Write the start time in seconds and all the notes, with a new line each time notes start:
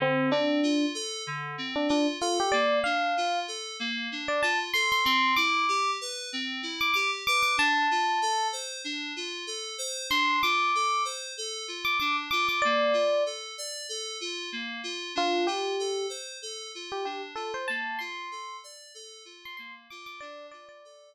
0.00 D3 C4
0.31 C4 D4
0.63 F4
0.94 A4
1.27 D3
1.58 C4
1.76 D4
1.89 D4 F4
2.21 F4 A4
2.40 G4
2.52 A#3 D5
2.84 D4 F5
3.17 F4
3.48 A4
3.80 A#3
4.12 D4
4.28 D5
4.43 F4 A5
4.74 A4 C6
4.92 C6
5.05 C4 C6
5.36 E4 D6
5.69 G4
6.01 B4
6.33 C4
6.63 E4
6.81 D6
6.94 G4 D6
7.27 B4 D6
7.43 D6
7.57 D4 A5
7.91 F4
8.22 A4
8.52 C5
8.84 D4
9.16 F4
9.47 A4
9.78 C5
10.10 D4 C6
10.43 F4 D6
10.75 A4
11.05 C5
11.38 A4
11.68 F4
11.85 D6
12.00 D4 D6
12.31 F4 D6
12.49 D6
12.62 A#3 D5
12.93 F4
13.26 A4
13.58 D5
13.89 A4
14.21 F4
14.52 A#3
14.84 F4
15.15 D4 F4
15.47 F4 G4
15.79 A4
16.09 C5
16.42 A4
16.75 F4
16.92 G4
17.05 D4 G4
17.35 F4 A4
17.54 C5
17.68 A#3 A5
17.99 F4 C6
18.31 A4
18.64 D5
18.94 A4
19.25 F4
19.45 C6
19.57 A#3 C6
19.90 F4 D6
20.06 D6
20.21 D4 D5
20.51 F4 D5
20.69 D5
20.85 A4